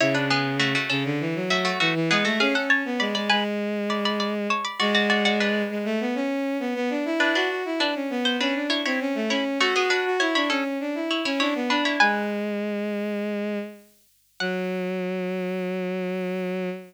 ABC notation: X:1
M:4/4
L:1/16
Q:1/4=100
K:F#m
V:1 name="Harpsichord"
[Ec] [DB] [B,G]2 [A,F] [A,F] [CA] z3 [A,F] [A,F] [A,F] z [B,G] [A,F] | [G^e] [Af] [ca]2 [db] [db] [Bg] z3 [db] [db] [db] z [ca] [db] | [Fd] [Fd] [Fd] [Fd] [DB]6 z6 | [DB] [DB]2 z [DB] z2 =c [DB]2 [E^c] [Ec] z2 [Ec] z |
[A,F] [B,G] [DB]2 [Ec] [Ec] [CA] z3 [Ec] [Ec] [Ec] z [DB] [Ec] | [Bg]6 z10 | f16 |]
V:2 name="Violin"
C,6 C, D, E, F,3 E, E, G, A, | C C2 B, G, G, G,8 z2 | G,6 G, A, B, C3 B, B, D E | E F F E D C B,2 C D2 ^B, C A, C2 |
F F F F E D C2 D E2 C D B, D2 | G,12 z4 | F,16 |]